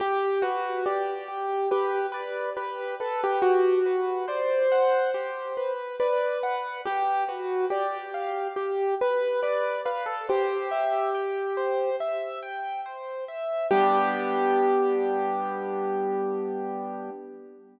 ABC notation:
X:1
M:4/4
L:1/16
Q:1/4=70
K:G
V:1 name="Acoustic Grand Piano"
G2 F2 G4 G2 B2 B2 A G | F4 c8 B4 | G2 F2 G4 G2 B2 B2 B A | G8 z8 |
G16 |]
V:2 name="Acoustic Grand Piano"
z2 B2 d2 G2 B2 d2 G2 B2 | G2 B2 d2 f2 G2 B2 d2 f2 | G2 B2 d2 =f2 z4 d2 f2 | c2 e2 g2 c2 e2 g2 c2 e2 |
[G,B,D]16 |]